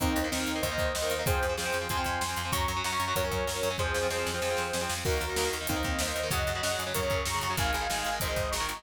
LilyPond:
<<
  \new Staff \with { instrumentName = "Lead 2 (sawtooth)" } { \time 4/4 \key ees \dorian \tempo 4 = 190 <c' ees'>4 <c' ees'>4 <c'' ees''>2 | <aes' c''>4 <aes' c''>4 <aes'' c'''>2 | <bes'' des'''>4 <bes'' des'''>4 <bes' des''>2 | <aes' c''>4 <aes' c''>2~ <aes' c''>8 r8 |
<ges' bes'>2 <c' ees'>4 <c'' ees''>4 | <ees'' ges''>2 <bes' des''>4 <bes'' des'''>4 | <f'' aes''>2 <c'' ees''>4 <bes'' des'''>4 | }
  \new Staff \with { instrumentName = "Overdriven Guitar" } { \time 4/4 \key ees \dorian <ees bes>8. <ees bes>16 <ees bes>16 <ees bes>8 <ees bes>16 <ees bes>16 <ees bes>4 <ees bes>8 <ees bes>16 | <f c'>8. <f c'>16 <f c'>16 <f c'>8 <f c'>16 <f c'>16 <f c'>4 <f c'>8 <f c'>16 | <ges des'>8. <ges des'>16 <ges des'>16 <ges des'>8 <ges des'>16 <ges des'>16 <ges des'>4 <ges des'>8 <ges des'>16 | <f c'>8. <f c'>16 <f c'>16 <f c'>8 <f c'>16 <f c'>16 <f c'>4 <f c'>8 <f c'>16 |
<ees bes>8. <ees bes>16 <ees bes>16 <ees bes>8 <ees bes>16 <ees bes>16 <ees bes>4 <ees bes>8 <ees bes>16 | <des ges>8. <des ges>16 <des ges>16 <des ges>8 <des ges>16 <des ges>16 <des ges>4 <des ges>8 <des ges>16 | <ees aes>8. <ees aes>16 <ees aes>16 <ees aes>8 <ees aes>16 <ees aes>16 <ees aes>4 <ees aes>8 <ees aes>16 | }
  \new Staff \with { instrumentName = "Electric Bass (finger)" } { \clef bass \time 4/4 \key ees \dorian ees,8 ees,8 ees,8 ees,8 ees,8 ees,8 ees,8 ees,8 | f,8 f,8 f,8 f,8 f,8 f,8 f,8 f,8 | ges,8 ges,8 ges,8 ges,8 ges,8 ges,8 ges,8 ges,8 | f,8 f,8 f,8 f,8 f,8 f,8 f,8 f,8 |
ees,8 ees,8 ees,8 ees,8 ees,8 ees,8 ees,8 ees,8 | ges,8 ges,8 ges,8 ges,8 ges,8 ges,8 ges,8 ges,8 | aes,,8 aes,,8 aes,,8 aes,,8 aes,,8 aes,,8 aes,,8 aes,,8 | }
  \new DrumStaff \with { instrumentName = "Drums" } \drummode { \time 4/4 <hh bd>8 hh8 sn8 hh8 <hh bd>8 <hh bd>8 sn8 hh8 | <hh bd>8 hh8 sn8 hh8 <hh bd>8 <hh bd>8 sn8 hh8 | <hh bd>8 hh8 sn8 hh8 <hh bd>8 <hh bd>8 sn8 hh8 | bd8 sn8 sn8 sn8 sn8 sn8 sn8 sn8 |
<cymc bd>8 hh8 sn8 hh8 <hh bd>8 <hh bd>8 sn8 hh8 | <hh bd>8 hh8 sn8 hh8 <hh bd>8 <hh bd>8 sn8 hh8 | <hh bd>8 hh8 sn8 hh8 <hh bd>8 <hh bd>8 sn8 hh8 | }
>>